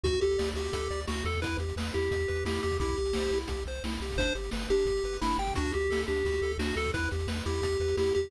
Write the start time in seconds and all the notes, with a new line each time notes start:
0.04 D2 F#4, kick, closed hi-hat
0.13 kick, closed hi-hat
0.21 D2 G4 A4, closed hi-hat
0.31 closed hi-hat
0.38 D2 D5, snare
0.46 closed hi-hat
0.54 D2 F#4 G4, closed hi-hat
0.65 closed hi-hat
0.73 D2 A4, kick, closed hi-hat
0.81 closed hi-hat
0.91 D2 D5, closed hi-hat
1.00 closed hi-hat
1.08 D2 F#4, snare
1.15 closed hi-hat
1.25 E2 A4, closed hi-hat
1.32 kick, closed hi-hat
1.42 E4 B4, kick, closed hi-hat
1.52 closed hi-hat
1.58 E2 G4, closed hi-hat
1.69 closed hi-hat
1.76 E2 B4, snare
1.87 closed hi-hat
1.92 E2 E4 G4, closed hi-hat
2.03 closed hi-hat
2.11 E2 G4, kick, closed hi-hat
2.20 closed hi-hat
2.28 E2 B4, closed hi-hat
2.35 closed hi-hat
2.45 E2 E4 G4, snare
2.55 closed hi-hat
2.62 E2 G4, closed hi-hat
2.71 kick, closed hi-hat
2.80 C2 E4 G4, kick, closed hi-hat
2.88 kick, closed hi-hat
2.97 C2 G4, closed hi-hat
3.06 closed hi-hat
3.13 C2 C5, snare
3.23 closed hi-hat
3.31 C2 E4, closed hi-hat
3.40 closed hi-hat
3.48 C2 G4, kick, closed hi-hat
3.57 closed hi-hat
3.66 C2 C5, closed hi-hat
3.75 closed hi-hat
3.84 C2 E4, snare
3.92 closed hi-hat
4.00 C2 G4, closed hi-hat
4.10 kick, open hi-hat
4.16 G1 D4 C5, kick, closed hi-hat
4.27 closed hi-hat
4.35 G1 G4, closed hi-hat
4.44 closed hi-hat
4.51 G1 B4, snare
4.62 closed hi-hat
4.68 G1 D4 G4, closed hi-hat
4.79 closed hi-hat
4.85 G1 G4, kick, closed hi-hat
4.97 closed hi-hat
5.04 G1 B4, closed hi-hat
5.13 closed hi-hat
5.21 G1 D4 E4, snare
5.31 closed hi-hat
5.38 G1 G4 G5, closed hi-hat
5.47 kick, closed hi-hat
5.54 D2 D4 F#4, kick, closed hi-hat
5.65 kick, closed hi-hat
5.72 D2 F#4 G4, closed hi-hat
5.81 closed hi-hat
5.90 D2 A4, snare
5.98 closed hi-hat
6.07 D2 D4 G4, closed hi-hat
6.16 closed hi-hat
6.25 D2 F#4, kick, closed hi-hat
6.32 closed hi-hat
6.42 D2 A4, closed hi-hat
6.52 closed hi-hat
6.58 D2 D4 F#4, snare
6.70 closed hi-hat
6.76 D2 F#4 A4, closed hi-hat
6.84 kick, closed hi-hat
6.94 E2 E4 B4, kick, closed hi-hat
7.04 closed hi-hat
7.11 E2 G4, closed hi-hat
7.19 closed hi-hat
7.27 E2 B4, snare
7.36 closed hi-hat
7.45 E2 E4 G4, closed hi-hat
7.54 closed hi-hat
7.62 E2 G4, kick, closed hi-hat
7.72 closed hi-hat
7.80 E2 B4, closed hi-hat
7.88 closed hi-hat
7.97 E2 E4 G4, snare
8.06 closed hi-hat
8.15 E2 G4, closed hi-hat
8.24 kick